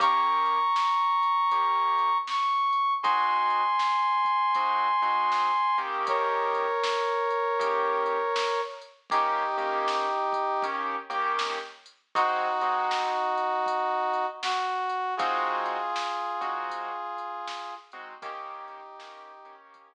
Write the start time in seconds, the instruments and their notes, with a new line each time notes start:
0.00 acoustic grand piano D#3 A#3 C#4 G4, brass section A#5 C#6, kick, closed hi-hat
0.46 closed hi-hat
0.76 snare
1.23 closed hi-hat
1.51 acoustic grand piano D#3 A#3 C#4 G4, kick, closed hi-hat
1.98 closed hi-hat
2.27 brass section C#6, snare
2.73 closed hi-hat
3.03 acoustic grand piano G#3 C4 D#4 F#4, brass section G#5 C6, kick, closed hi-hat
3.50 closed hi-hat
3.79 snare
4.25 kick, closed hi-hat
4.55 acoustic grand piano G#3 C4 D#4 F#4, kick, closed hi-hat
5.02 acoustic grand piano G#3 C4 D#4 F#4, closed hi-hat
5.32 snare
5.78 acoustic grand piano D#3 A#3 C#4 G4, closed hi-hat
6.07 brass section A#4 C#5, kick, closed hi-hat
6.55 closed hi-hat
6.84 snare
7.30 closed hi-hat
7.59 acoustic grand piano D#3 A#3 C#4 G4, kick, closed hi-hat
8.06 closed hi-hat
8.36 snare
8.81 closed hi-hat
9.10 acoustic grand piano D#3 A#3 C#4 G4, brass section D#4 G4, kick, closed hi-hat
9.57 acoustic grand piano D#3 A#3 C#4 G4, closed hi-hat
9.88 snare
10.33 kick, closed hi-hat
10.62 acoustic grand piano D#3 A#3 C#4 G4, kick, closed hi-hat
11.10 acoustic grand piano D#3 A#3 C#4 G4, closed hi-hat
11.39 snare
11.86 closed hi-hat
12.15 acoustic grand piano G#3 C4 D#4 F#4, brass section D#4 F#4, kick, closed hi-hat
12.61 acoustic grand piano G#3 C4 D#4 F#4, closed hi-hat
12.91 snare
13.38 closed hi-hat
13.66 kick, closed hi-hat
14.14 closed hi-hat
14.43 brass section F#4, snare
14.90 closed hi-hat
15.17 acoustic grand piano G#3 C4 D#4 F#4, brass section F4 G#4, kick, closed hi-hat
15.66 closed hi-hat
15.96 snare
16.41 acoustic grand piano G#3 C4 D#4 F#4, kick, closed hi-hat
16.69 kick, closed hi-hat
17.18 closed hi-hat
17.47 snare
17.92 acoustic grand piano G#3 C4 D#4 F#4, closed hi-hat
18.22 acoustic grand piano D#3 A#3 C#4 G4, brass section D#4 G4, kick, closed hi-hat
18.68 closed hi-hat
18.99 acoustic grand piano D#3 A#3 C#4 G4, snare
19.45 acoustic grand piano D#3 A#3 C#4 G4, closed hi-hat
19.74 kick, closed hi-hat